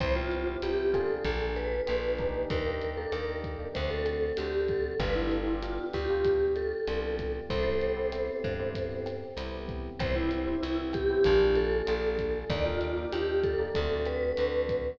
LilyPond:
<<
  \new Staff \with { instrumentName = "Vibraphone" } { \time 4/4 \key c \major \tempo 4 = 96 c''16 f'8. g'8 a'4 ces''4. | bes'8. a'16 bes'8 r8 c''16 a'8. g'8 a'8 | b'16 e'8. f'8 g'4 a'4. | <a' c''>2. r4 |
c''16 e'8. e'8 g'4 a'4. | d''16 f'8. g'8 a'4 b'4. | }
  \new Staff \with { instrumentName = "Electric Piano 1" } { \time 4/4 \key c \major <b c' e' g'>16 <b c' e' g'>8 <b c' e' g'>16 <b c' e' g'>8 <bes d' f' aes'>4. <bes d' f' aes'>8 <bes d' ees' g'>8~ | <bes d' ees' g'>16 <bes d' ees' g'>8 <bes d' ees' g'>16 <bes d' ees' g'>8. <bes d' ees' g'>16 <a c' d' fis'>4 <a c' d' fis'>4 | <b d' f' g'>16 <b d' f' g'>8 <b d' f' g'>16 <b d' f' g'>8. <b d' f' g'>4~ <b d' f' g'>16 <b d' f' g'>4 | <b c' e' g'>16 <b c' e' g'>8 <b c' e' g'>16 <b c' e' g'>8. <b c' e' g'>4~ <b c' e' g'>16 <b c' e' g'>4 |
<b c' e' g'>16 <b c' e' g'>8 <b c' e' g'>16 <b c' e' g'>8. <b c' e' g'>16 <bes d' f' aes'>4 <bes d' f' aes'>4 | <bes d' ees' g'>16 <bes d' ees' g'>8 <bes d' ees' g'>16 <bes d' ees' g'>8. <bes d' ees' g'>16 <a c' d' fis'>4 <a c' d' fis'>4 | }
  \new Staff \with { instrumentName = "Electric Bass (finger)" } { \clef bass \time 4/4 \key c \major c,4 c,4 bes,,4 bes,,4 | ees,4 ees,4 d,4 d,4 | g,,4. d,4. c,4 | c,4. g,4. c,4 |
c,4 c,4 bes,,4 bes,,4 | ees,4 ees,4 d,4 d,4 | }
  \new DrumStaff \with { instrumentName = "Drums" } \drummode { \time 4/4 <hh bd ss>8 hh8 hh8 <hh bd ss>8 <hh bd>8 hh8 <hh ss>8 <hh bd>8 | <hh bd>8 hh8 <hh ss>8 <hh bd>8 <hh bd>8 <hh ss>8 hh8 <hh bd>8 | <hh bd ss>8 hh8 hh8 <hh bd ss>8 <hh bd>8 hh8 <hh ss>8 <hh bd>8 | <hh bd>8 hh8 <hh ss>8 <hh bd>8 <hh bd>8 <hh ss>8 hh8 <hh bd>8 |
<hh bd ss>8 hh8 hh8 <hh bd ss>8 <hh bd>8 hh8 <hh ss>8 <hh bd>8 | <hh bd>8 hh8 <hh ss>8 <hh bd>8 <hh bd>8 <hh ss>8 hh8 <hh bd>8 | }
>>